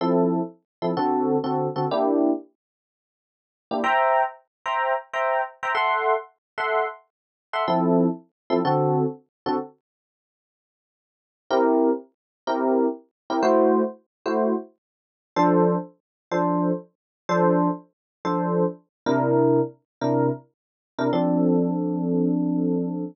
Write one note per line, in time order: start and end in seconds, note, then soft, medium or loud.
0.01 0.40 F3 loud
0.01 0.40 C4 loud
0.01 0.40 E4 medium
0.01 0.40 A4 loud
0.82 0.92 F3 medium
0.82 0.92 C4 medium
0.82 0.92 E4 medium
0.82 0.92 A4 medium
0.97 1.36 D3 loud
0.97 1.36 C4 loud
0.97 1.36 F#4 loud
0.97 1.36 A4 loud
1.44 1.67 D3 medium
1.44 1.67 C4 loud
1.44 1.67 F#4 medium
1.44 1.67 A4 medium
1.76 1.86 D3 medium
1.76 1.86 C4 medium
1.76 1.86 F#4 medium
1.76 1.86 A4 medium
1.91 2.31 A#3 loud
1.91 2.31 D4 loud
1.91 2.31 E4 loud
1.91 2.31 G4 loud
3.71 3.81 A#3 medium
3.71 3.81 D4 medium
3.71 3.81 E4 medium
3.71 3.81 G4 medium
3.84 4.23 C5 medium
3.84 4.23 E5 loud
3.84 4.23 G5 loud
3.84 4.23 A#5 loud
4.66 4.93 C5 medium
4.66 4.93 E5 medium
4.66 4.93 G5 medium
4.66 4.93 A#5 medium
5.13 5.41 C5 medium
5.13 5.41 E5 medium
5.13 5.41 G5 medium
5.13 5.41 A#5 medium
5.63 5.73 C5 medium
5.63 5.73 E5 medium
5.63 5.73 G5 medium
5.63 5.73 A#5 medium
5.75 6.14 A4 loud
5.75 6.14 E5 medium
5.75 6.14 F#5 loud
5.75 6.14 C6 loud
6.58 6.86 A4 medium
6.58 6.86 E5 medium
6.58 6.86 F#5 medium
6.58 6.86 C6 medium
7.53 7.63 A4 medium
7.53 7.63 E5 medium
7.53 7.63 F#5 medium
7.53 7.63 C6 medium
7.68 8.07 F3 loud
7.68 8.07 C4 loud
7.68 8.07 E4 loud
7.68 8.07 A4 loud
8.50 8.60 F3 loud
8.50 8.60 C4 loud
8.50 8.60 E4 loud
8.50 8.60 A4 loud
8.65 9.04 D3 loud
8.65 9.04 C4 loud
8.65 9.04 F#4 loud
8.65 9.04 A4 loud
9.46 9.56 D3 medium
9.46 9.56 C4 loud
9.46 9.56 F#4 loud
9.46 9.56 A4 loud
11.51 11.90 C4 loud
11.51 11.90 E4 loud
11.51 11.90 G4 loud
11.51 11.90 A#4 loud
12.47 12.87 C4 loud
12.47 12.87 E4 loud
12.47 12.87 G4 loud
12.47 12.87 A#4 loud
13.30 13.40 C4 medium
13.30 13.40 E4 loud
13.30 13.40 G4 medium
13.30 13.40 A#4 medium
13.43 13.82 A3 loud
13.43 13.82 E4 loud
13.43 13.82 F#4 loud
13.43 13.82 C5 loud
14.26 14.54 A3 loud
14.26 14.54 E4 loud
14.26 14.54 F#4 medium
14.26 14.54 C5 medium
15.36 15.76 F3 loud
15.36 15.76 D4 loud
15.36 15.76 A4 loud
15.36 15.76 C5 loud
16.31 16.71 F3 loud
16.31 16.71 D4 loud
16.31 16.71 A4 medium
16.31 16.71 C5 loud
17.29 17.68 F3 loud
17.29 17.68 D4 loud
17.29 17.68 A4 loud
17.29 17.68 C5 loud
18.25 18.64 F3 loud
18.25 18.64 D4 medium
18.25 18.64 A4 loud
18.25 18.64 C5 loud
19.06 19.60 C3 loud
19.06 19.60 D4 loud
19.06 19.60 E4 loud
19.06 19.60 A#4 loud
20.01 20.29 C3 loud
20.01 20.29 D4 medium
20.01 20.29 E4 medium
20.01 20.29 A#4 loud
20.98 21.09 C3 medium
20.98 21.09 D4 loud
20.98 21.09 E4 medium
20.98 21.09 A#4 loud
21.13 23.04 F3 loud
21.13 23.04 C4 loud
21.13 23.04 D4 loud
21.13 23.04 A4 medium